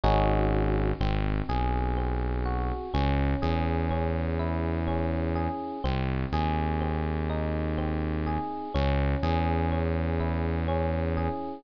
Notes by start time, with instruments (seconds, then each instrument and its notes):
0.03 synth bass 1 G#1, electric piano 1 C#4 D#4 F#4 G#4
1.00 synth bass 1 G#1, electric piano 1 C4
1.49 synth bass 1 B1, electric piano 1 G#4
1.97 electric piano 1 C4
2.45 electric piano 1 F#4
2.94 synth bass 1 C#2, electric piano 1 C#4
3.42 synth bass 1 E2, electric piano 1 G#4
3.91 electric piano 1 C#4
4.39 electric piano 1 E4
4.87 electric piano 1 C#4
5.35 electric piano 1 G#4
5.84 synth bass 1 C2, electric piano 1 C4
6.32 synth bass 1 D#2, electric piano 1 G#4
6.81 electric piano 1 C4
7.30 electric piano 1 D#4
7.78 electric piano 1 C4
8.26 electric piano 1 G#4
8.74 synth bass 1 C#2, electric piano 1 C#4
9.23 synth bass 1 E2, electric piano 1 G#4
9.72 electric piano 1 C#4
10.20 electric piano 1 E4
10.68 electric piano 1 C#4
11.17 electric piano 1 G#4